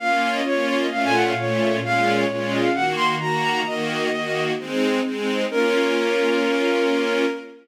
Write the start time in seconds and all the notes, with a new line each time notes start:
0.00 A#3 C#4 F4 F5
0.34 D#5
0.45 A#3 C#4 F4 C#5
0.67 C#5
0.81 D#5
0.91 A#2 A3 C#4 F4 F5
1.04 G#5
1.14 F#5
1.25 F5
1.37 A#2 A3 C#4 F4 C#5
1.83 A#2 G#3 C#4 F4 F5
2.18 C#5
2.29 A#2 G#3 C#4 F4 C#5
2.52 D#5
2.62 F5
2.74 D#3 A#3 F#4 F#5
2.96 C6
3.20 D#3 A#3 F#4 A#5
3.66 D#3 A#3 F#4 D#5
4.12 D#3 A#3 F#4
4.58 G#3 C4 D#4
5.04 G#3 C4 D#4
5.49 A#3 C#4 F4 A#4